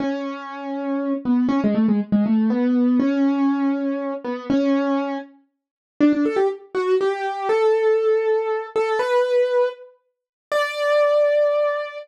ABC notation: X:1
M:6/8
L:1/16
Q:3/8=80
K:A
V:1 name="Acoustic Grand Piano"
C10 B,2 | C G, A, G, z G, A,2 B,4 | C10 B,2 | C6 z6 |
[K:D] D D A G z2 F2 G4 | A10 A2 | B6 z6 | d12 |]